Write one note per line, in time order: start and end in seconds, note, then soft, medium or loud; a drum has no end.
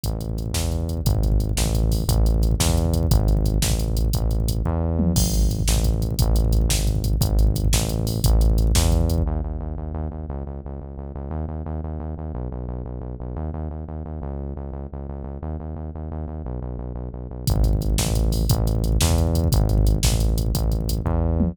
0.04 0.52 A1 loud
0.04 kick loud
0.04 closed hi-hat loud
0.12 kick medium
0.20 kick medium
0.20 closed hi-hat medium
0.29 kick medium
0.38 kick medium
0.38 closed hi-hat medium
0.46 kick medium
0.53 1.00 E2 loud
0.53 kick medium
0.53 snare loud
0.63 kick medium
0.72 kick medium
0.72 closed hi-hat medium
0.80 kick medium
0.89 kick medium
0.89 closed hi-hat medium
0.97 kick medium
1.05 1.52 G#1 loud
1.05 kick loud
1.05 closed hi-hat loud
1.15 kick loud
1.23 kick loud
1.23 closed hi-hat medium
1.32 kick loud
1.40 kick medium
1.40 closed hi-hat medium
1.49 kick medium
1.57 2.04 A1 loud
1.57 kick loud
1.57 snare loud
1.66 kick loud
1.74 kick loud
1.74 closed hi-hat medium
1.83 kick medium
1.92 kick loud
1.92 open hi-hat medium
2.00 kick loud
2.08 2.55 A1 loud
2.08 kick loud
2.08 closed hi-hat loud
2.18 kick medium
2.26 kick medium
2.26 closed hi-hat medium
2.34 kick medium
2.42 kick medium
2.42 closed hi-hat medium
2.51 kick loud
2.60 3.07 E2 loud
2.60 kick loud
2.60 snare loud
2.69 kick loud
2.77 kick medium
2.77 closed hi-hat medium
2.85 kick loud
2.94 kick loud
2.94 closed hi-hat loud
3.03 kick loud
3.11 3.58 G#1 loud
3.11 kick loud
3.11 closed hi-hat loud
3.20 kick loud
3.28 kick loud
3.28 closed hi-hat medium
3.37 kick loud
3.45 kick loud
3.45 closed hi-hat medium
3.54 kick medium
3.62 4.10 A1 loud
3.62 kick loud
3.62 snare loud
3.71 kick loud
3.79 kick medium
3.79 closed hi-hat medium
3.88 kick loud
3.97 kick medium
3.97 closed hi-hat loud
4.05 kick medium
4.13 4.62 A1 loud
4.13 kick loud
4.13 closed hi-hat loud
4.22 kick medium
4.31 kick medium
4.31 closed hi-hat medium
4.40 kick medium
4.48 kick loud
4.48 closed hi-hat loud
4.56 kick medium
4.65 5.13 E2 loud
4.65 kick loud
4.99 mid tom loud
5.16 5.63 G#1 loud
5.16 kick loud
5.16 crash loud
5.25 kick loud
5.34 kick medium
5.34 closed hi-hat medium
5.42 kick loud
5.50 kick loud
5.50 closed hi-hat medium
5.59 kick loud
5.68 6.15 A1 loud
5.68 kick loud
5.68 snare loud
5.76 kick loud
5.84 kick loud
5.84 closed hi-hat medium
5.94 kick loud
6.02 kick medium
6.02 closed hi-hat medium
6.10 kick loud
6.19 6.68 A1 loud
6.19 kick loud
6.19 closed hi-hat loud
6.28 kick medium
6.36 kick loud
6.36 closed hi-hat loud
6.44 kick loud
6.52 kick loud
6.52 closed hi-hat medium
6.61 kick loud
6.69 7.16 G#1 loud
6.69 kick loud
6.69 snare loud
6.79 kick medium
6.87 kick loud
6.87 closed hi-hat medium
6.95 kick loud
7.04 kick loud
7.04 closed hi-hat loud
7.13 kick medium
7.21 7.68 G#1 loud
7.21 kick loud
7.21 closed hi-hat loud
7.30 kick loud
7.39 kick medium
7.39 closed hi-hat medium
7.47 kick loud
7.55 kick loud
7.55 closed hi-hat loud
7.64 kick loud
7.73 8.20 A1 loud
7.73 kick loud
7.73 snare loud
7.81 kick loud
7.89 kick medium
7.89 closed hi-hat medium
7.99 kick medium
8.07 kick medium
8.07 open hi-hat medium
8.15 kick medium
8.24 8.72 A1 loud
8.24 kick loud
8.24 closed hi-hat loud
8.33 kick medium
8.41 kick loud
8.41 closed hi-hat medium
8.50 kick medium
8.58 kick medium
8.58 closed hi-hat medium
8.67 kick loud
8.75 9.23 E2 loud
8.75 kick loud
8.75 snare loud
8.84 kick loud
8.92 kick loud
8.92 closed hi-hat medium
9.01 kick medium
9.09 kick medium
9.09 closed hi-hat loud
9.18 kick loud
9.26 9.41 D#2 medium
9.44 9.59 D#2 medium
9.60 9.75 D#2 medium
9.78 9.92 D#2 medium
9.94 10.08 D#2 medium
10.11 10.26 D#2 medium
10.29 10.44 C#2 medium
10.46 10.61 C#2 medium
10.65 10.80 C#2 medium
10.81 10.96 C#2 medium
10.98 11.12 C#2 medium
11.15 11.30 C#2 medium
11.31 11.45 D#2 medium
11.48 11.63 D#2 medium
11.66 11.81 D#2 medium
11.84 11.99 D#2 medium
12.00 12.14 D#2 medium
12.18 12.32 D#2 medium
12.34 12.49 B1 medium
12.52 12.67 B1 medium
12.68 12.83 B1 medium
12.85 13.00 B1 medium
13.01 13.15 B1 medium
13.20 13.35 B1 medium
13.36 13.51 D#2 medium
13.54 13.68 D#2 medium
13.70 13.85 D#2 medium
13.88 14.03 D#2 medium
14.05 14.20 D#2 medium
14.22 14.53 C#2 medium
14.56 14.71 C#2 medium
14.72 14.87 C#2 medium
14.92 15.07 C#2 medium
15.09 15.23 C#2 medium
15.24 15.38 C#2 medium
15.42 15.57 D#2 medium
15.60 15.75 D#2 medium
15.76 15.90 D#2 medium
15.95 16.09 D#2 medium
16.11 16.26 D#2 medium
16.28 16.42 D#2 medium
16.45 16.59 B1 medium
16.62 16.77 B1 medium
16.78 16.93 B1 medium
16.95 17.09 B1 medium
17.13 17.27 B1 medium
17.30 17.45 B1 medium
17.47 17.96 G#1 loud
17.47 kick loud
17.47 closed hi-hat loud
17.56 kick loud
17.64 kick loud
17.64 closed hi-hat medium
17.73 kick loud
17.81 kick loud
17.81 closed hi-hat medium
17.90 kick medium
17.98 18.46 A1 loud
17.98 kick loud
17.98 snare loud
18.07 kick loud
18.15 kick loud
18.15 closed hi-hat medium
18.24 kick loud
18.32 kick loud
18.32 open hi-hat medium
18.41 kick loud
18.49 18.98 A1 loud
18.49 kick loud
18.49 closed hi-hat loud
18.58 kick medium
18.67 kick medium
18.67 closed hi-hat medium
18.75 kick loud
18.84 kick medium
18.84 closed hi-hat medium
18.92 kick loud
19.01 19.48 E2 loud
19.01 kick loud
19.01 snare loud
19.10 kick loud
19.18 kick loud
19.18 closed hi-hat medium
19.27 kick loud
19.35 kick loud
19.35 closed hi-hat loud
19.44 kick loud
19.52 19.99 G#1 loud
19.52 kick loud
19.52 closed hi-hat loud
19.61 kick loud
19.69 kick loud
19.69 closed hi-hat medium
19.78 kick loud
19.86 kick loud
19.86 closed hi-hat medium
19.95 kick medium
20.03 20.51 A1 loud
20.03 kick loud
20.03 snare loud
20.12 kick loud
20.20 kick medium
20.20 closed hi-hat medium
20.29 kick loud
20.38 kick medium
20.38 closed hi-hat loud
20.46 kick medium
20.54 21.02 A1 loud
20.54 kick loud
20.54 closed hi-hat loud
20.63 kick medium
20.72 kick medium
20.72 closed hi-hat medium
20.81 kick medium
20.89 kick loud
20.89 closed hi-hat loud
20.98 kick medium
21.05 21.52 E2 loud
21.05 kick loud
21.40 mid tom loud